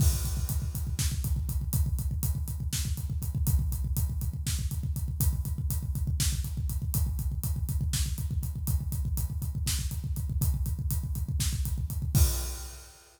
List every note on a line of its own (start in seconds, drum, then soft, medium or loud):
0.00 kick loud
0.00 crash loud
0.13 kick medium
0.25 kick medium
0.25 closed hi-hat medium
0.37 kick medium
0.49 kick medium
0.49 closed hi-hat medium
0.62 kick medium
0.75 kick medium
0.75 closed hi-hat medium
0.87 kick medium
0.99 kick medium
0.99 snare medium
1.12 kick medium
1.24 kick medium
1.24 closed hi-hat medium
1.36 kick medium
1.49 kick medium
1.49 closed hi-hat medium
1.61 kick medium
1.73 kick medium
1.73 closed hi-hat medium
1.86 kick medium
1.99 kick medium
1.99 closed hi-hat medium
2.11 kick medium
2.23 kick medium
2.23 closed hi-hat medium
2.35 kick medium
2.48 kick medium
2.48 closed hi-hat medium
2.60 kick medium
2.73 kick medium
2.73 snare medium
2.85 kick medium
2.97 kick medium
2.97 closed hi-hat medium
3.10 kick medium
3.22 kick medium
3.22 closed hi-hat medium
3.35 kick medium
3.47 kick medium
3.47 closed hi-hat medium
3.59 kick medium
3.72 kick medium
3.72 closed hi-hat medium
3.85 kick medium
3.97 kick medium
3.97 closed hi-hat medium
4.10 kick medium
4.21 kick medium
4.21 closed hi-hat medium
4.33 kick medium
4.46 kick medium
4.46 snare medium
4.59 kick medium
4.71 kick medium
4.71 closed hi-hat medium
4.83 kick medium
4.96 kick medium
4.96 closed hi-hat medium
5.08 kick medium
5.20 kick medium
5.20 closed hi-hat loud
5.33 kick medium
5.45 kick medium
5.45 closed hi-hat medium
5.58 kick medium
5.70 kick medium
5.70 closed hi-hat medium
5.83 kick medium
5.95 kick medium
5.95 closed hi-hat medium
6.07 kick medium
6.20 kick medium
6.20 snare loud
6.33 kick medium
6.44 kick medium
6.44 closed hi-hat medium
6.57 kick medium
6.69 kick medium
6.69 closed hi-hat medium
6.82 kick medium
6.94 kick medium
6.94 closed hi-hat medium
7.07 kick medium
7.19 kick medium
7.19 closed hi-hat medium
7.32 kick medium
7.43 kick medium
7.43 closed hi-hat medium
7.56 kick medium
7.69 kick medium
7.69 closed hi-hat medium
7.81 kick medium
7.93 kick medium
7.93 snare medium
8.06 kick medium
8.18 kick medium
8.18 closed hi-hat medium
8.31 kick medium
8.43 kick medium
8.43 closed hi-hat medium
8.56 kick medium
8.67 kick medium
8.67 closed hi-hat medium
8.80 kick medium
8.92 kick medium
8.92 closed hi-hat medium
9.05 kick medium
9.17 kick medium
9.17 closed hi-hat medium
9.30 kick medium
9.42 kick medium
9.42 closed hi-hat medium
9.55 kick medium
9.66 kick medium
9.66 snare medium
9.79 kick medium
9.91 kick medium
9.91 closed hi-hat medium
10.04 kick medium
10.16 kick medium
10.16 closed hi-hat medium
10.30 kick medium
10.41 kick medium
10.41 closed hi-hat medium
10.54 kick medium
10.66 kick medium
10.66 closed hi-hat medium
10.79 kick medium
10.90 kick medium
10.90 closed hi-hat medium
11.04 kick medium
11.15 kick medium
11.15 closed hi-hat medium
11.29 kick medium
11.40 kick medium
11.40 snare medium
11.53 kick medium
11.65 kick medium
11.65 closed hi-hat medium
11.78 kick medium
11.90 kick medium
11.90 closed hi-hat medium
12.02 kick medium
12.15 kick loud
12.15 crash loud